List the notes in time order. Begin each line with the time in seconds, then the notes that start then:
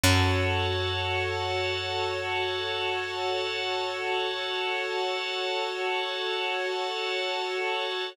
0.04 F#2 F#4 A4 C#5 F#5 A5